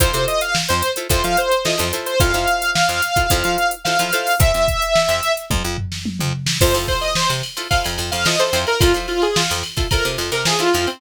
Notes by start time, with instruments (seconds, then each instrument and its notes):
0.00 electric bass (finger) F2, pizzicato strings E4 F4 A4 C5, lead 2 (sawtooth) C5, kick, closed hi-hat
0.13 electric bass (finger) C3, pizzicato strings E4 F4 A4 C5, closed hi-hat
0.28 lead 2 (sawtooth) D#5, closed hi-hat
0.41 lead 2 (sawtooth) F5, closed hi-hat
0.55 snare
0.68 electric bass (finger) F2, lead 2 (sawtooth) C5, closed hi-hat
0.82 closed hi-hat
0.96 pizzicato strings E4 F4 A4 C5, closed hi-hat
1.09 electric bass (finger) F2, pizzicato strings E4 F4 A4 C5, lead 2 (sawtooth) C5, kick, closed hi-hat
1.24 electric bass (finger) F3, lead 2 (sawtooth) F5, closed hi-hat
1.37 lead 2 (sawtooth) C5, closed hi-hat
1.51 closed hi-hat
1.65 pizzicato strings E4 F4 A4 C5, lead 2 (sawtooth) D#5, snare
1.78 electric bass (finger) F2, pizzicato strings E4 F4 A4 C5, snare, closed hi-hat
1.93 pizzicato strings E4 F4 A4 C5, snare, closed hi-hat
2.06 lead 2 (sawtooth) C5, closed hi-hat
2.20 electric bass (finger) F2, pizzicato strings E4 F4 A4 C5, lead 2 (sawtooth) F5, kick, closed hi-hat
2.34 electric bass (finger) F2, pizzicato strings E4 F4 A4 C5, snare, closed hi-hat
2.48 closed hi-hat
2.62 closed hi-hat
2.75 lead 2 (sawtooth) F5, snare
2.89 electric bass (finger) F2, closed hi-hat
3.02 closed hi-hat
3.16 pizzicato strings E4 F4 A4 C5, kick, closed hi-hat
3.30 electric bass (finger) F2, pizzicato strings E4 F4 A4 C5, kick, closed hi-hat
3.44 electric bass (finger) F3, closed hi-hat
3.58 closed hi-hat
3.71 closed hi-hat
3.85 pizzicato strings E4 F4 A4 C5, lead 2 (sawtooth) F5, snare
3.99 electric bass (finger) F3, pizzicato strings E4 F4 A4 C5, snare, closed hi-hat
4.13 pizzicato strings E4 F4 A4 C5, closed hi-hat
4.27 open hi-hat
4.40 electric bass (finger) F2, lead 2 (sawtooth) E5, kick, closed hi-hat
4.54 electric bass (finger) F2, closed hi-hat
4.68 kick, snare, closed hi-hat
4.82 closed hi-hat
4.96 snare
5.08 electric bass (finger) F2, snare, closed hi-hat
5.23 closed hi-hat
5.37 closed hi-hat
5.50 electric bass (finger) F2, kick, high tom
5.64 electric bass (finger) F2
5.78 floor tom
5.92 snare
6.06 high tom
6.19 electric bass (finger) F2, mid tom
6.46 snare
6.61 electric bass (finger) F2, pizzicato strings E4 F4 A4 C5, lead 2 (sawtooth) C5, kick, crash
6.74 electric bass (finger) F2, pizzicato strings E4 F4 A4 C5, snare, ride
6.88 lead 2 (sawtooth) C5, kick, ride
7.01 lead 2 (sawtooth) D#5, ride
7.15 lead 2 (sawtooth) C5, snare
7.29 electric bass (finger) C3, ride
7.43 ride
7.57 pizzicato strings E4 F4 A4 C5, ride
7.70 pizzicato strings E4 F4 A4 C5, lead 2 (sawtooth) F5, kick, ride
7.84 electric bass (finger) F2, ride
7.98 electric bass (finger) F2, ride
8.11 electric bass (finger) F2, lead 2 (sawtooth) F5, ride
8.25 pizzicato strings E4 F4 A4 C5, lead 2 (sawtooth) D#5, snare
8.39 pizzicato strings E4 F4 A4 C5, lead 2 (sawtooth) C5, snare, ride
8.53 electric bass (finger) F2, pizzicato strings E4 F4 A4 C5, ride
8.67 lead 2 (sawtooth) A#4, ride
8.80 electric bass (finger) F2, pizzicato strings E4 F4 A4 C5, lead 2 (sawtooth) F4, kick, ride
8.94 electric bass (finger) F3, pizzicato strings E4 F4 A4 C5, ride
9.08 lead 2 (sawtooth) F4, ride
9.22 lead 2 (sawtooth) G#4, ride
9.36 lead 2 (sawtooth) F4, snare
9.50 electric bass (finger) F2, ride
9.63 snare, ride
9.77 pizzicato strings E4 F4 A4 C5, kick, ride
9.91 pizzicato strings E4 F4 A4 C5, lead 2 (sawtooth) A#4, kick, ride
10.05 electric bass (finger) C3, ride
10.18 electric bass (finger) F2, ride
10.32 electric bass (finger) C3, lead 2 (sawtooth) A#4, ride
10.45 pizzicato strings E4 F4 A4 C5, lead 2 (sawtooth) G#4, snare
10.59 pizzicato strings E4 F4 A4 C5, lead 2 (sawtooth) F4, snare, ride
10.74 electric bass (finger) F2, pizzicato strings E4 F4 A4 C5, ride
10.87 lead 2 (sawtooth) C4, ride